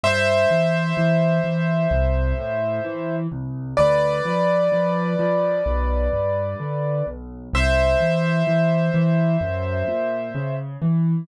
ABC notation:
X:1
M:4/4
L:1/8
Q:1/4=64
K:Am
V:1 name="Acoustic Grand Piano"
[ce]8 | [Bd]8 | [ce]8 |]
V:2 name="Acoustic Grand Piano" clef=bass
G,, E, E, E, C,, A,, E, C,, | D,, F, F, F, B,,, G,, D, B,,, | C,, E, E, E, ^F,, ^A,, ^C, E, |]